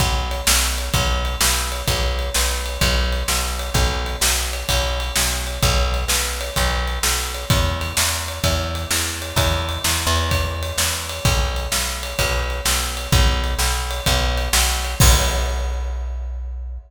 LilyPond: <<
  \new Staff \with { instrumentName = "Electric Bass (finger)" } { \clef bass \time 4/4 \key b \major \tempo 4 = 128 b,,4 b,,4 b,,4 b,,4 | b,,4 b,,4 b,,4 b,,4 | b,,4 b,,4 b,,4 b,,4 | b,,4 b,,4 b,,4 b,,4 |
e,4 e,4 e,4 e,4 | e,4 e,8 e,4. e,4 | b,,4 b,,4 b,,4 b,,4 | b,,4 b,,4 b,,4 b,,4 |
b,,1 | }
  \new DrumStaff \with { instrumentName = "Drums" } \drummode { \time 4/4 \tuplet 3/2 { <bd cymr>8 r8 cymr8 sn8 r8 cymr8 <bd cymr>8 r8 cymr8 sn8 r8 cymr8 } | \tuplet 3/2 { <bd cymr>8 r8 cymr8 sn8 r8 cymr8 <bd cymr>8 r8 cymr8 sn8 r8 cymr8 } | \tuplet 3/2 { <bd cymr>8 r8 cymr8 sn8 r8 cymr8 <bd cymr>8 r8 cymr8 sn8 r8 cymr8 } | \tuplet 3/2 { <bd cymr>8 r8 cymr8 sn8 r8 cymr8 <bd cymr>8 r8 cymr8 sn8 r8 cymr8 } |
\tuplet 3/2 { <bd cymr>8 r8 cymr8 sn8 r8 cymr8 <bd cymr>8 r8 cymr8 sn8 r8 cymr8 } | \tuplet 3/2 { <bd cymr>8 r8 cymr8 sn8 r8 cymr8 <bd cymr>8 r8 cymr8 sn8 r8 cymr8 } | \tuplet 3/2 { <bd cymr>8 r8 cymr8 sn8 r8 cymr8 <bd cymr>8 r8 cymr8 sn8 r8 cymr8 } | \tuplet 3/2 { <bd cymr>8 r8 cymr8 sn8 r8 cymr8 <bd cymr>8 r8 cymr8 sn8 r8 cymr8 } |
<cymc bd>4 r4 r4 r4 | }
>>